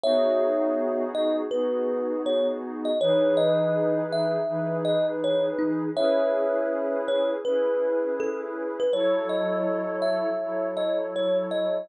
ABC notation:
X:1
M:4/4
L:1/16
Q:"Swing 16ths" 1/4=81
K:C#m
V:1 name="Kalimba"
[ce]6 d z B4 c z2 d | c2 d4 e4 d z c z D2 | [ce]6 c z B4 A z2 B | c2 d4 e4 d z c z d2 |]
V:2 name="Pad 2 (warm)"
[B,DFG]8 [B,DFG]8 | [E,DGB]8 [E,DGB]8 | [CEGB]8 [CEGB]8 | [F,EAc]8 [F,EAc]8 |]